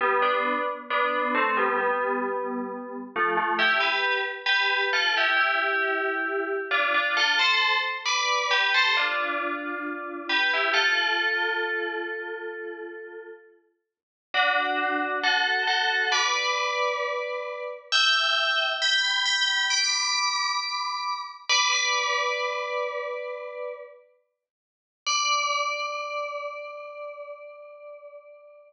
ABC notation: X:1
M:4/4
L:1/16
Q:1/4=67
K:Gmix
V:1 name="Tubular Bells"
[G,B,] [B,D]2 z [B,D]2 [A,C] [G,B,] [G,B,]6 [F,A,] [F,A,] | [EG] [GB]2 z [GB]2 [FA] [EG] [EG]6 [DF] [DF] | [FA] [Ac]2 z [Bd]2 [GB] [Ac] [DF]6 [GB] [EG] | [FA]12 z4 |
[K:Dmix] [DF]4 [FA]2 [FA]2 [Bd]8 | [eg]4 [gb]2 [gb]2 [bd']8 | [Bd] [Bd]11 z4 | d16 |]